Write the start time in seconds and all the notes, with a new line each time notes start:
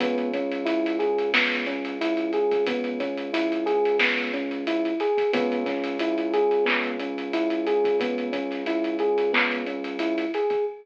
0.00 C#2 B3, kick, closed hi-hat
0.18 closed hi-hat
0.33 C#4, kick, closed hi-hat
0.52 closed hi-hat
0.65 E4, closed hi-hat
0.86 closed hi-hat
0.99 G#4, closed hi-hat
1.18 closed hi-hat
1.34 B3, snare
1.52 closed hi-hat
1.66 C#4, closed hi-hat
1.85 closed hi-hat
2.01 E4, closed hi-hat
2.17 closed hi-hat
2.33 G#4, closed hi-hat
2.51 kick, closed hi-hat
2.67 B3, kick, closed hi-hat
2.84 closed hi-hat
3.00 C#4, kick, closed hi-hat
3.18 closed hi-hat
3.33 E4, closed hi-hat
3.52 closed hi-hat
3.66 G#4, closed hi-hat
3.85 closed hi-hat
3.99 B3, snare
4.18 closed hi-hat
4.34 C#4, closed hi-hat
4.51 closed hi-hat
4.67 E4, closed hi-hat
4.85 closed hi-hat
5.00 G#4, closed hi-hat
5.18 kick, closed hi-hat
5.33 C#2 B3, kick, closed hi-hat
5.52 closed hi-hat
5.66 C#4, kick, snare, closed hi-hat
5.84 closed hi-hat
5.99 E4, closed hi-hat
6.18 closed hi-hat
6.34 G#4, closed hi-hat
6.51 closed hi-hat
6.65 B3, clap
6.84 closed hi-hat
6.99 C#4, closed hi-hat
7.18 closed hi-hat
7.33 E4, closed hi-hat
7.50 closed hi-hat
7.67 G#4, closed hi-hat
7.84 kick, closed hi-hat
8.00 B3, kick, closed hi-hat
8.18 closed hi-hat
8.33 C#4, kick, closed hi-hat
8.51 snare, closed hi-hat
8.66 E4, closed hi-hat
8.84 closed hi-hat
8.99 G#4, closed hi-hat
9.18 closed hi-hat
9.33 B3, clap
9.52 closed hi-hat
9.67 C#4, closed hi-hat
9.84 closed hi-hat
9.99 E4, closed hi-hat
10.18 closed hi-hat
10.34 G#4, closed hi-hat
10.50 kick, closed hi-hat